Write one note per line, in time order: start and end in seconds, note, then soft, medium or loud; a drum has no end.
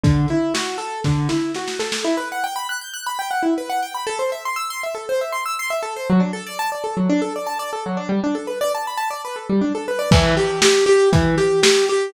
0.04 0.26 D3 loud
0.04 kick medium
0.04 closed hi-hat medium
0.28 0.53 E4 medium
0.28 closed hi-hat medium
0.54 0.77 F#4 medium
0.54 snare medium
0.78 1.00 A4 medium
0.78 closed hi-hat medium
1.04 1.28 D3 loud
1.04 kick medium
1.04 snare medium
1.29 1.52 E4 medium
1.29 snare medium
1.55 1.78 F#4 medium
1.55 snare medium
1.68 snare medium
1.79 2.02 A4 medium
1.79 snare medium
1.92 snare medium
2.05 2.16 E4 loud
2.17 2.29 B4 medium
2.32 2.43 F#5 medium
2.44 2.55 G5 medium
2.56 2.67 B5 medium
2.69 2.80 F#6 medium
2.81 2.93 G6 medium
2.94 3.05 F#6 medium
3.07 3.18 B5 medium
3.19 3.30 G5 medium
3.31 3.42 F#5 medium
3.43 3.54 E4 medium
3.58 3.69 B4 medium
3.70 3.81 F#5 medium
3.82 3.94 G5 medium
3.95 4.06 B5 medium
4.07 4.18 A4 loud
4.19 4.30 C5 medium
4.32 4.43 E5 medium
4.45 4.57 C6 medium
4.56 4.68 E6 medium
4.70 4.82 C6 medium
4.83 4.95 E5 medium
4.95 5.06 A4 medium
5.09 5.20 C5 medium
5.21 5.33 E5 medium
5.32 5.44 C6 medium
5.46 5.57 E6 medium
5.59 5.71 C6 loud
5.70 5.82 E5 medium
5.83 5.94 A4 medium
5.96 6.08 C5 medium
6.10 6.21 F#3 loud
6.20 6.31 D4 medium
6.33 6.45 A4 medium
6.47 6.58 D5 medium
6.59 6.70 A5 medium
6.72 6.83 D5 medium
6.84 6.95 A4 medium
6.97 7.08 F#3 medium
7.10 7.21 D4 loud
7.22 7.33 A4 medium
7.36 7.47 D5 medium
7.47 7.58 A5 medium
7.59 7.71 D5 medium
7.73 7.84 A4 medium
7.86 7.97 F#3 medium
7.97 8.08 D4 medium
8.09 8.20 G3 medium
8.24 8.35 D4 medium
8.35 8.46 A4 medium
8.47 8.59 B4 medium
8.61 8.72 D5 loud
8.75 8.86 A5 medium
8.87 8.99 B5 medium
8.97 9.09 A5 medium
9.11 9.22 D5 medium
9.25 9.36 B4 medium
9.36 9.47 A4 medium
9.50 9.61 G3 medium
9.61 9.73 D4 medium
9.75 9.86 A4 medium
9.88 9.99 B4 medium
9.99 10.10 D5 medium
10.11 10.35 E3 loud
10.11 kick loud
10.11 crash loud
10.37 10.60 G4 loud
10.37 closed hi-hat medium
10.62 10.85 G4 loud
10.62 snare loud
10.86 11.09 G4 loud
10.86 closed hi-hat medium
11.13 11.35 E3 loud
11.13 kick medium
11.13 closed hi-hat loud
11.38 11.60 G4 loud
11.38 closed hi-hat medium
11.63 11.86 G4 loud
11.63 snare loud
11.88 12.12 G4 loud
11.88 closed hi-hat medium